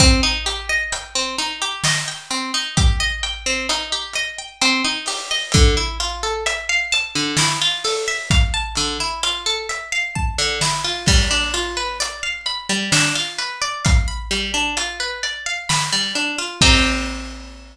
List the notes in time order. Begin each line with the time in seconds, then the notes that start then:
0.00 C4, kick, closed hi-hat
0.23 D#4
0.46 G4, closed hi-hat
0.69 D#5
0.92 G5, closed hi-hat
1.15 C4
1.38 D#4, closed hi-hat
1.62 G4
1.84 D#5, snare
2.08 G5
2.30 C4, closed hi-hat
2.54 D#4
2.77 G4, kick, closed hi-hat
3.00 D#5
3.23 G5, closed hi-hat
3.46 C4
3.69 D#4, closed hi-hat
3.92 G4
4.13 D#5, closed hi-hat
4.38 G5
4.62 C4, closed hi-hat
4.84 D#4
5.06 G4, open hi-hat
5.31 D#5
5.52 D3, kick, closed hi-hat
5.77 E4
6.00 F4, closed hi-hat
6.23 A4
6.46 E5, closed hi-hat
6.69 F5
6.92 A5, closed hi-hat
7.15 D3
7.37 E4, snare
7.62 F4
7.84 A4, open hi-hat
8.08 E5
8.30 F5, kick, closed hi-hat
8.54 A5
8.75 D3, closed hi-hat
9.00 E4
9.23 F4, closed hi-hat
9.46 A4
9.69 E5, closed hi-hat
9.92 F5
10.15 A5, kick
10.38 D3
10.61 E4, snare
10.84 F4
11.06 G3, kick, crash
11.31 D4
11.54 F4, closed hi-hat
11.77 B4
12.00 D5, closed hi-hat
12.23 F5
12.46 B5, closed hi-hat
12.69 G3
12.92 D4, snare
13.15 F4
13.38 B4, closed hi-hat
13.62 D5
13.85 F5, kick, closed hi-hat
14.08 B5
14.31 G3, closed hi-hat
14.54 D4
14.77 F4, closed hi-hat
15.00 B4
15.23 D5, closed hi-hat
15.46 F5
15.69 B5, snare
15.93 G3
16.15 D4, closed hi-hat
16.38 F4
16.61 C4 D#4 G4, kick, crash